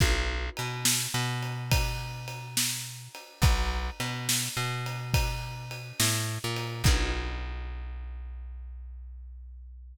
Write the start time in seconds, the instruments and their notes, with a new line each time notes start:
0.00 electric bass (finger) B1, kick, crash
0.57 electric bass (finger) B2, ride
0.85 snare
1.14 electric bass (finger) B2
1.43 ride
1.72 kick, ride
2.28 ride
2.57 snare
3.15 ride
3.42 electric bass (finger) B1, kick, ride
4.00 electric bass (finger) B2, ride
4.29 snare
4.57 electric bass (finger) B2
4.86 ride
5.14 kick, ride
5.71 ride
6.00 electric bass (finger) A2, snare
6.44 electric bass (finger) A#2
6.56 ride
6.84 electric bass (finger) B1, kick, crash